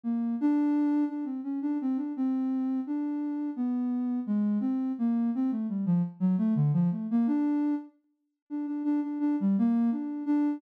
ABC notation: X:1
M:6/8
L:1/16
Q:3/8=57
K:none
V:1 name="Ocarina"
_B,2 D4 D C _D =D C D | C4 D4 B,4 | _A,2 C2 _B,2 C =A, G, F, z _G, | A, D, F, A, _B, D3 z4 |
D D D D D G, _B,2 D2 D2 |]